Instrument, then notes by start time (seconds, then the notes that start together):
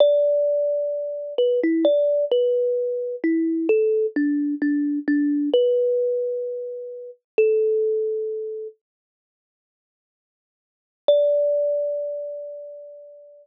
kalimba
0.00 D5
1.38 B4
1.63 E4
1.85 D5
2.32 B4
3.24 E4
3.69 A4
4.16 D4
4.62 D4
5.08 D4
5.53 B4
7.38 A4
11.08 D5